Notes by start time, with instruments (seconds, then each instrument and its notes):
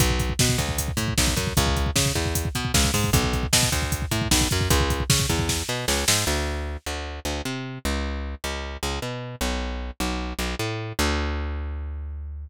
0.00 electric bass (finger) B1, kick, closed hi-hat
0.10 kick
0.20 kick, closed hi-hat
0.29 kick
0.39 electric bass (finger) B2, kick, snare
0.49 kick
0.58 electric bass (finger) D2, kick, closed hi-hat
0.69 kick
0.78 kick, closed hi-hat
0.88 kick
0.97 electric bass (finger) A2, kick, closed hi-hat
1.08 kick
1.18 electric bass (finger) B1, kick, snare
1.27 kick
1.37 electric bass (finger) F#2, kick, closed hi-hat
1.47 kick
1.57 electric bass (finger) C#2, kick, closed hi-hat
1.67 kick
1.76 kick, closed hi-hat
1.86 kick
1.96 electric bass (finger) C#3, kick, snare
2.06 kick
2.15 electric bass (finger) E2, kick
2.25 kick
2.35 kick, closed hi-hat
2.45 kick
2.55 electric bass (finger) B2, kick, closed hi-hat
2.65 kick
2.74 electric bass (finger) C#2, kick, snare
2.84 kick
2.94 electric bass (finger) G#2, kick, open hi-hat
3.04 kick
3.13 electric bass (finger) B1, kick, closed hi-hat
3.24 kick
3.33 kick, closed hi-hat
3.43 kick
3.53 electric bass (finger) B2, kick, snare
3.63 kick
3.72 electric bass (finger) D2, kick, closed hi-hat
3.82 kick
3.92 kick, closed hi-hat
4.02 kick
4.11 electric bass (finger) A2, kick, closed hi-hat
4.22 kick
4.31 electric bass (finger) B1, kick, snare
4.41 kick
4.51 electric bass (finger) F#2, kick, closed hi-hat
4.61 kick
4.70 electric bass (finger) C#2, kick, closed hi-hat
4.80 kick
4.90 kick, closed hi-hat
5.00 kick
5.10 electric bass (finger) C#3, kick, snare
5.20 kick
5.29 electric bass (finger) E2, kick, closed hi-hat
5.39 kick
5.49 kick, snare
5.69 electric bass (finger) B2
5.88 electric bass (finger) C#2, snare
6.08 electric bass (finger) G#2, snare
6.27 electric bass (finger) D2
6.86 electric bass (finger) D2
7.25 electric bass (finger) D2
7.45 electric bass (finger) C3
7.85 electric bass (finger) C#2
8.44 electric bass (finger) C#2
8.83 electric bass (finger) C#2
9.02 electric bass (finger) B2
9.41 electric bass (finger) B1
10.00 electric bass (finger) B1
10.39 electric bass (finger) B1
10.59 electric bass (finger) A2
10.99 electric bass (finger) D2